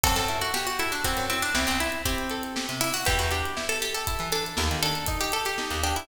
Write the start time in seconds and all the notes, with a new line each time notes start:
0.04 F#2 C4 A4, kick, closed hi-hat
0.16 F#2 A4, closed hi-hat
0.29 E4, closed hi-hat
0.41 F#4, closed hi-hat
0.54 F#4 G4, snare
0.67 F#4, closed hi-hat
0.79 E4 A4, closed hi-hat
0.92 D4, closed hi-hat
1.04 C4 F#4, kick, closed hi-hat
1.17 F#2, closed hi-hat
1.30 C4 E4, closed hi-hat
1.42 D4, closed hi-hat
1.55 C2 C4 E4, snare
1.67 C2 C4, closed hi-hat
1.80 E4, closed hi-hat
1.92 closed hi-hat
2.05 C4 G4, kick, closed hi-hat
2.18 closed hi-hat
2.30 A4, closed hi-hat
2.43 closed hi-hat
2.56 G4, snare
2.69 C3, closed hi-hat
2.81 E4, closed hi-hat
2.93 F#4, open hi-hat
3.05 E2 B3 G4, kick, closed hi-hat
3.19 E2 F#4, closed hi-hat
3.31 D4 G4, closed hi-hat
3.46 closed hi-hat
3.57 E4, snare
3.69 A4, closed hi-hat
3.82 G4, closed hi-hat
3.94 A4, closed hi-hat
4.07 E4, kick, closed hi-hat
4.19 E3, closed hi-hat
4.32 D4 A4, closed hi-hat
4.46 closed hi-hat
4.57 D#2 A#3, snare
4.71 D#3, closed hi-hat
4.83 D4 A4, closed hi-hat
4.95 closed hi-hat
5.07 D#4, kick, closed hi-hat
5.21 G4, closed hi-hat
5.32 G4 A4, closed hi-hat
5.45 G4, closed hi-hat
5.58 D#4, snare
5.71 D#2, closed hi-hat
5.84 D4 G4, closed hi-hat
5.96 E4, closed hi-hat